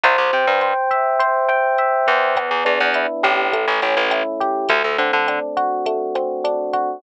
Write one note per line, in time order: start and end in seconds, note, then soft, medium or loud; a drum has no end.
0.04 0.17 C2 loud
0.04 0.62 C5 loud
0.04 kick medium
0.04 closed hi-hat loud
0.18 0.31 C2 loud
0.33 0.46 C3 loud
0.33 1.48 G5 medium
0.47 0.74 G2 loud
0.61 1.19 C5 medium
0.61 cross-stick medium
0.61 closed hi-hat medium
0.91 1.78 E5 medium
0.91 kick medium
0.91 closed hi-hat medium
1.19 2.07 C5 loud
1.19 kick medium
1.19 closed hi-hat loud
1.49 2.32 G5 medium
1.49 cross-stick loud
1.78 2.34 E5 medium
1.78 closed hi-hat medium
2.07 2.50 E2 loud
2.07 2.35 C5 medium
2.07 kick medium
2.07 closed hi-hat medium
2.36 3.47 B3 loud
2.36 kick loud
2.36 cross-stick loud
2.36 closed hi-hat loud
2.51 2.64 E2 medium
2.65 2.79 E2 loud
2.65 3.48 D4 medium
2.65 closed hi-hat medium
2.80 3.07 E2 loud
2.94 3.50 E4 medium
2.94 closed hi-hat loud
3.23 3.66 A1 loud
3.23 3.51 G4 medium
3.23 kick medium
3.23 cross-stick medium
3.23 closed hi-hat medium
3.52 4.64 A3 loud
3.52 kick medium
3.52 closed hi-hat loud
3.68 3.81 A1 loud
3.82 3.95 A1 medium
3.82 4.65 C#4 medium
3.82 closed hi-hat medium
3.97 4.23 A1 loud
4.11 4.67 E4 medium
4.11 cross-stick loud
4.11 closed hi-hat loud
4.40 4.68 G4 medium
4.40 kick medium
4.40 closed hi-hat medium
4.69 4.83 D2 loud
4.69 5.86 A3 medium
4.69 kick loud
4.69 closed hi-hat loud
4.84 4.97 D2 medium
4.98 5.12 D3 loud
4.98 6.15 C4 medium
4.98 closed hi-hat medium
5.13 5.39 D3 loud
5.28 6.44 D4 medium
5.28 cross-stick medium
5.28 closed hi-hat loud
5.57 6.73 F#4 medium
5.57 kick medium
5.57 closed hi-hat medium
5.86 6.97 A3 medium
5.86 kick medium
5.86 closed hi-hat loud
6.15 6.98 C4 medium
6.15 cross-stick medium
6.15 closed hi-hat medium
6.44 7.00 D4 medium
6.44 closed hi-hat loud
6.73 7.01 F#4 medium
6.73 kick medium
6.73 closed hi-hat medium